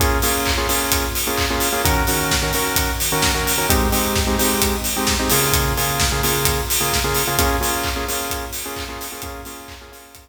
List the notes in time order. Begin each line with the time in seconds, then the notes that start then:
0.00 A#3 C#4 F4 G#4, kick, closed hi-hat
0.22 A#3 C#4 F4 G#4, open hi-hat
0.45 kick, clap
0.57 A#3 C#4 F4 G#4
0.69 A#3 C#4 F4 G#4, open hi-hat
0.92 kick, closed hi-hat
1.15 open hi-hat
1.27 A#3 C#4 F4 G#4
1.37 kick, clap
1.50 A#3 C#4 F4 G#4
1.60 open hi-hat
1.73 A#3 C#4 F4 G#4
1.84 D#3 C#4 F#4 A#4, kick, closed hi-hat
2.07 D#3 C#4 F#4 A#4, open hi-hat
2.31 kick, snare
2.42 D#3 C#4 F#4 A#4
2.53 D#3 C#4 F#4 A#4, open hi-hat
2.76 kick, closed hi-hat
3.00 open hi-hat
3.12 D#3 C#4 F#4 A#4
3.22 kick, snare
3.35 D#3 C#4 F#4 A#4
3.47 open hi-hat
3.58 D#3 C#4 F#4 A#4
3.69 G#3 C4 D#4 G4, kick, closed hi-hat
3.92 G#3 C4 D#4 G4, open hi-hat
4.16 kick, snare
4.27 G#3 C4 D#4 G4
4.38 G#3 C4 D#4 G4, open hi-hat
4.62 kick, closed hi-hat
4.84 open hi-hat
4.96 G#3 C4 D#4 G4
5.07 kick, snare
5.19 G#3 C4 D#4 G4
5.30 C#3 A#3 F4 G#4, open hi-hat
5.53 kick, closed hi-hat
5.77 C#3 A#3 F4 G#4, open hi-hat
6.00 kick, snare
6.12 C#3 A#3 F4 G#4
6.23 C#3 A#3 F4 G#4, open hi-hat
6.45 kick, closed hi-hat
6.70 open hi-hat
6.80 C#3 A#3 F4 G#4
6.92 kick, snare
7.04 C#3 A#3 F4 G#4
7.15 open hi-hat
7.27 C#3 A#3 F4 G#4
7.38 A#3 C#4 F4 G#4, kick, closed hi-hat
7.61 A#3 C#4 F4 G#4, open hi-hat
7.83 kick, clap
7.96 A#3 C#4 F4 G#4
8.08 A#3 C#4 F4 G#4, open hi-hat
8.30 kick, closed hi-hat
8.53 open hi-hat
8.65 A#3 C#4 F4 G#4
8.76 kick, clap
8.89 A#3 C#4 F4 G#4
9.01 open hi-hat
9.12 A#3 C#4 F4 G#4
9.22 A#3 C#4 F4 G#4, kick, closed hi-hat
9.45 A#3 C#4 F4 G#4, open hi-hat
9.68 kick, clap
9.81 A#3 C#4 F4 G#4
9.92 A#3 C#4 F4 G#4, open hi-hat
10.15 kick, closed hi-hat